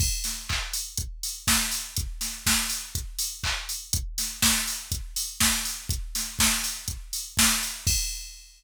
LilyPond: \new DrumStaff \drummode { \time 4/4 \tempo 4 = 122 <cymc bd>8 <hho sn>8 <hc bd>8 hho8 <hh bd>8 hho8 <bd sn>8 hho8 | <hh bd>8 <hho sn>8 <bd sn>8 hho8 <hh bd>8 hho8 <hc bd>8 hho8 | <hh bd>8 <hho sn>8 <bd sn>8 hho8 <hh bd>8 hho8 <bd sn>8 hho8 | <hh bd>8 <hho sn>8 <bd sn>8 hho8 <hh bd>8 hho8 <bd sn>8 hho8 |
<cymc bd>4 r4 r4 r4 | }